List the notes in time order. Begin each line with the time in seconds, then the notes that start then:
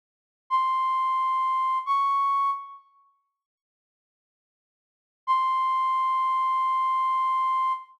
0.50 C6
1.86 C#6
5.27 C6